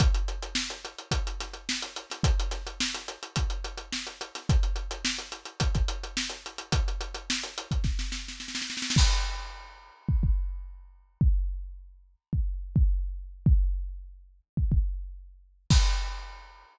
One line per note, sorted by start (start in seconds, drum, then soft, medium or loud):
0.00 kick loud
0.00 closed hi-hat medium
0.14 closed hi-hat medium
0.28 closed hi-hat medium
0.43 closed hi-hat medium
0.55 snare loud
0.70 closed hi-hat medium
0.85 closed hi-hat medium
0.98 closed hi-hat medium
1.11 kick medium
1.11 closed hi-hat medium
1.27 closed hi-hat medium
1.40 snare soft
1.40 closed hi-hat medium
1.54 closed hi-hat medium
1.69 snare loud
1.82 closed hi-hat medium
1.96 closed hi-hat medium
2.10 snare soft
2.10 closed hi-hat medium
2.23 kick medium
2.23 closed hi-hat medium
2.40 closed hi-hat medium
2.51 snare soft
2.51 closed hi-hat medium
2.67 closed hi-hat medium
2.80 snare loud
2.94 snare soft
2.94 closed hi-hat medium
3.08 closed hi-hat medium
3.23 closed hi-hat medium
3.36 kick medium
3.36 closed hi-hat medium
3.50 closed hi-hat medium
3.64 closed hi-hat medium
3.77 closed hi-hat medium
3.93 snare medium
4.07 closed hi-hat medium
4.21 closed hi-hat medium
4.35 snare soft
4.35 closed hi-hat medium
4.49 kick loud
4.49 closed hi-hat medium
4.63 closed hi-hat medium
4.76 closed hi-hat medium
4.91 closed hi-hat medium
5.05 snare loud
5.18 closed hi-hat medium
5.32 closed hi-hat medium
5.45 closed hi-hat medium
5.60 kick medium
5.60 closed hi-hat medium
5.75 kick medium
5.75 closed hi-hat medium
5.88 closed hi-hat medium
6.04 closed hi-hat medium
6.17 snare medium
6.30 closed hi-hat medium
6.46 closed hi-hat medium
6.58 closed hi-hat medium
6.72 kick medium
6.72 closed hi-hat medium
6.88 closed hi-hat medium
7.01 closed hi-hat medium
7.14 closed hi-hat medium
7.30 snare loud
7.43 snare soft
7.43 closed hi-hat medium
7.58 closed hi-hat medium
7.71 kick medium
7.71 closed hi-hat medium
7.84 kick medium
7.84 snare medium
7.99 snare medium
8.12 snare medium
8.28 snare medium
8.40 snare medium
8.48 snare medium
8.55 snare medium
8.62 snare medium
8.70 snare medium
8.77 snare medium
8.82 snare medium
8.90 snare medium
8.96 kick loud
8.96 crash loud
10.09 kick medium
10.23 kick medium
11.21 kick loud
12.33 kick medium
12.76 kick loud
13.46 kick loud
14.57 kick medium
14.72 kick medium
15.70 kick loud
15.70 crash loud